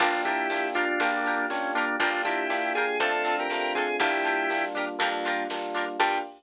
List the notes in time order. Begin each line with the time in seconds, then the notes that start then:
0.00 G1 A#3 D4 F4 G4 A#4, kick, crash
0.14 snare, closed hi-hat
0.25 D4 E4 F4 G4 A#4, kick, closed hi-hat
0.39 closed hi-hat
0.50 A#3 D4 F4 G4, snare
0.65 closed hi-hat
0.75 D4 F4 G4 A#4, kick, snare, closed hi-hat
0.89 closed hi-hat
1.00 A#1 A#3 D4 F4 G4 A#4, kick, closed hi-hat
1.14 snare, closed hi-hat
1.25 D4 F4 G4 A#4, closed hi-hat
1.39 closed hi-hat
1.50 A#3 C#4 D4 F4 G4, snare
1.64 snare, closed hi-hat
1.75 A#3 D4 F4 G4 A#4, closed hi-hat
1.89 closed hi-hat
2.00 G1 A#3 D4 F4 G4 A#4, kick, closed hi-hat
2.14 snare, closed hi-hat
2.25 D4 E4 F4 G4 A#4, kick, closed hi-hat
2.40 closed hi-hat
2.50 A#3 D4 F4 G4, snare
2.64 closed hi-hat
2.75 D4 F4 G4 G#4 A#4, closed hi-hat
2.89 snare, closed hi-hat
3.00 F2 A3 C4 D4 F4 A4, kick, closed hi-hat
3.14 snare, closed hi-hat
3.25 C4 D4 F4 A4, snare, closed hi-hat
3.39 G4 A#4, closed hi-hat
3.50 A3 C4 D4 F4, snare
3.64 closed hi-hat
3.75 C4 D4 F4 G#4 A4, kick, closed hi-hat
3.90 closed hi-hat
4.00 G1 G3 A#3 D4 E4 F4 G4 A#4, kick, closed hi-hat
4.14 snare, closed hi-hat
4.25 D4 F4 G4 A#4, closed hi-hat
4.39 closed hi-hat
4.50 G3 A#3 D4 F4, snare
4.64 closed hi-hat
4.75 D4 F4 G4 A#4, kick, closed hi-hat
4.89 closed hi-hat
4.99 F2 G3 A#3 D4 F4 G4 A#4, kick, closed hi-hat
5.14 snare, closed hi-hat
5.25 D4 F4 G4 A#4, closed hi-hat
5.39 closed hi-hat
5.50 G3 A#3 D4 F4, snare
5.64 closed hi-hat
5.74 D4 F4 G4 A#4, closed hi-hat
5.89 closed hi-hat
5.99 G2 A#3 D4 F4 G4 A#4, kick, crash